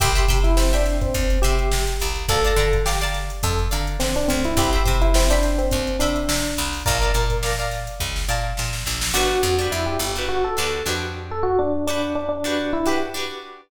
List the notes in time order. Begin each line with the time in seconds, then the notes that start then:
0.00 C2 G4 E5 G5 B5 C6, kick, closed hi-hat
0.15 E5 G5 B5 C6, closed hi-hat
0.28 C3 E5 G5 B5 C6, kick, closed hi-hat
0.44 E4, snare, closed hi-hat
0.57 C4 E5 G5 B5 C6, snare
0.73 D4 E5 G5 B5 C6, snare, closed hi-hat
0.86 snare, closed hi-hat
1.01 C4, kick, closed hi-hat
1.14 D#2, kick, closed hi-hat
1.30 closed hi-hat
1.42 C3 G4 E5 G5 B5 C6, closed hi-hat
1.59 closed hi-hat
1.72 C3, snare
1.87 closed hi-hat
2.00 C2, snare, closed hi-hat
2.16 closed hi-hat
2.28 D2 A4 D5 F5 A5 A#5, kick, closed hi-hat
2.44 D5 F5 A5 A#5, closed hi-hat
2.56 D3 D5 F5 A5 A#5, kick, closed hi-hat
2.73 kick, closed hi-hat
2.86 G4 D5 F5 A5 A#5, snare
3.01 D5 F5 A5 A#5, closed hi-hat
3.14 snare, closed hi-hat
3.30 closed hi-hat
3.43 F2 A4, kick, closed hi-hat
3.59 closed hi-hat
3.71 D3 D5 F5 A5 A#5, closed hi-hat
3.87 closed hi-hat
4.00 D3 C4, snare
4.16 D4, closed hi-hat
4.28 D2 C4, snare, closed hi-hat
4.44 E4, snare, closed hi-hat
4.57 C2 G4 C5 E5 G5 B5, kick, closed hi-hat
4.73 C5 E5 G5 B5, closed hi-hat
4.85 C3 C5 E5 G5 B5, kick, closed hi-hat
5.02 E4, closed hi-hat
5.14 C4 C5 E5 G5 B5, snare
5.30 D4 C5 E5 G5 B5, closed hi-hat
5.43 snare, closed hi-hat
5.58 C4, closed hi-hat
5.71 D#2, kick, closed hi-hat
5.87 closed hi-hat
5.99 C3 D4 C5 E5 G5 B5, snare, closed hi-hat
6.16 closed hi-hat
6.29 C3, snare
6.44 snare, closed hi-hat
6.57 C2, closed hi-hat
6.73 open hi-hat
6.86 A#1 A#4 D5 F5 A5 A#5, kick, closed hi-hat
7.01 D5 F5 A5 A#5, closed hi-hat
7.14 A#2 D5 F5 A5 A#5, closed hi-hat
7.30 kick, closed hi-hat
7.43 D5 F5 A5 A#5, snare
7.59 D5 F5 A5 A#5, closed hi-hat
7.71 snare, closed hi-hat
7.87 closed hi-hat
8.00 C#2, kick
8.16 snare
8.29 A#2 D5 F5 A5 A#5
8.57 A#2, snare
8.73 snare
8.86 A#1, snare
9.01 snare
9.14 G1 D4 F#4 G4 B4
9.43 F2
9.59 D4 F#4 G4 B4
9.72 F2 E4
9.86 G4
9.99 G1
10.16 D4 F#4 G4 B4
10.29 F#4
10.44 A4
10.57 D2 D4 F#4 G4 B4
10.86 F2 D4 F#4 G4 B4
11.31 A4
11.43 F#4
11.59 D4
11.87 D4 F#4 G4 B4
12.15 D4
12.29 D4
12.44 D4 F#4 G4 B4
12.73 E4
12.86 D4 F#4 G4 B4
13.14 D4 F#4 G4 B4